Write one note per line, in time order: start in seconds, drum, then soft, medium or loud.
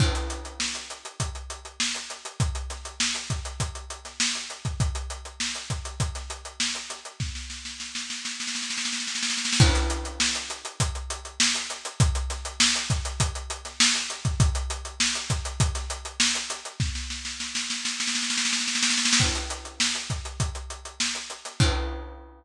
0.00 kick loud
0.00 crash loud
0.15 snare soft
0.15 closed hi-hat medium
0.30 closed hi-hat medium
0.45 closed hi-hat medium
0.60 snare medium
0.75 closed hi-hat medium
0.90 closed hi-hat medium
1.05 closed hi-hat medium
1.20 kick medium
1.20 closed hi-hat medium
1.35 closed hi-hat medium
1.50 closed hi-hat medium
1.65 closed hi-hat medium
1.80 snare loud
1.95 closed hi-hat medium
2.10 snare soft
2.10 closed hi-hat medium
2.25 closed hi-hat medium
2.40 kick medium
2.40 closed hi-hat medium
2.55 closed hi-hat medium
2.70 snare soft
2.70 closed hi-hat medium
2.85 closed hi-hat medium
3.00 snare loud
3.15 closed hi-hat medium
3.30 kick medium
3.30 closed hi-hat medium
3.45 closed hi-hat medium
3.60 kick medium
3.60 closed hi-hat medium
3.75 closed hi-hat medium
3.90 closed hi-hat medium
4.05 snare soft
4.05 closed hi-hat medium
4.20 snare loud
4.35 closed hi-hat medium
4.50 closed hi-hat medium
4.65 kick medium
4.65 closed hi-hat medium
4.80 kick medium
4.80 closed hi-hat medium
4.95 closed hi-hat medium
5.10 closed hi-hat medium
5.25 closed hi-hat medium
5.40 snare medium
5.55 snare soft
5.55 closed hi-hat medium
5.70 kick medium
5.70 closed hi-hat medium
5.85 closed hi-hat medium
6.00 kick medium
6.00 closed hi-hat medium
6.15 snare soft
6.15 closed hi-hat medium
6.30 closed hi-hat medium
6.45 closed hi-hat medium
6.60 snare loud
6.75 closed hi-hat medium
6.90 snare soft
6.90 closed hi-hat medium
7.05 closed hi-hat medium
7.20 kick medium
7.20 snare medium
7.35 snare medium
7.50 snare medium
7.65 snare medium
7.80 snare medium
7.95 snare medium
8.10 snare medium
8.25 snare medium
8.40 snare medium
8.47 snare medium
8.55 snare medium
8.62 snare medium
8.70 snare medium
8.78 snare medium
8.85 snare medium
8.93 snare medium
9.00 snare medium
9.07 snare medium
9.15 snare medium
9.23 snare medium
9.30 snare medium
9.37 snare medium
9.45 snare medium
9.53 snare loud
9.60 kick loud
9.60 crash loud
9.75 snare soft
9.75 closed hi-hat medium
9.90 closed hi-hat medium
10.05 closed hi-hat medium
10.20 snare loud
10.35 closed hi-hat medium
10.50 closed hi-hat medium
10.65 closed hi-hat medium
10.80 kick medium
10.80 closed hi-hat loud
10.95 closed hi-hat medium
11.10 closed hi-hat medium
11.25 closed hi-hat medium
11.40 snare loud
11.55 closed hi-hat medium
11.70 snare soft
11.70 closed hi-hat medium
11.85 closed hi-hat medium
12.00 kick loud
12.00 closed hi-hat loud
12.15 closed hi-hat medium
12.30 snare soft
12.30 closed hi-hat medium
12.45 closed hi-hat medium
12.60 snare loud
12.75 closed hi-hat medium
12.90 kick medium
12.90 closed hi-hat medium
13.05 closed hi-hat medium
13.20 kick medium
13.20 closed hi-hat loud
13.35 closed hi-hat medium
13.50 closed hi-hat medium
13.65 snare soft
13.65 closed hi-hat medium
13.80 snare loud
13.95 closed hi-hat medium
14.10 closed hi-hat medium
14.25 kick medium
14.25 closed hi-hat medium
14.40 kick loud
14.40 closed hi-hat loud
14.55 closed hi-hat medium
14.70 closed hi-hat medium
14.85 closed hi-hat medium
15.00 snare loud
15.15 snare soft
15.15 closed hi-hat medium
15.30 kick medium
15.30 closed hi-hat medium
15.45 closed hi-hat medium
15.60 kick loud
15.60 closed hi-hat loud
15.75 snare soft
15.75 closed hi-hat medium
15.90 closed hi-hat medium
16.05 closed hi-hat medium
16.20 snare loud
16.35 closed hi-hat medium
16.50 snare soft
16.50 closed hi-hat medium
16.65 closed hi-hat medium
16.80 kick medium
16.80 snare medium
16.95 snare medium
17.10 snare medium
17.25 snare medium
17.40 snare medium
17.55 snare medium
17.70 snare medium
17.85 snare medium
18.00 snare medium
18.07 snare medium
18.15 snare medium
18.23 snare medium
18.30 snare medium
18.37 snare medium
18.45 snare medium
18.53 snare medium
18.60 snare medium
18.68 snare medium
18.75 snare medium
18.82 snare loud
18.90 snare medium
18.98 snare medium
19.05 snare loud
19.13 snare loud
19.20 kick medium
19.20 crash medium
19.35 closed hi-hat medium
19.50 closed hi-hat medium
19.65 closed hi-hat medium
19.80 snare loud
19.95 closed hi-hat medium
20.10 kick medium
20.10 closed hi-hat medium
20.25 closed hi-hat medium
20.40 kick medium
20.40 closed hi-hat medium
20.55 closed hi-hat medium
20.70 closed hi-hat medium
20.85 closed hi-hat medium
21.00 snare loud
21.15 closed hi-hat medium
21.30 closed hi-hat medium
21.45 snare soft
21.45 closed hi-hat medium
21.60 kick loud
21.60 crash loud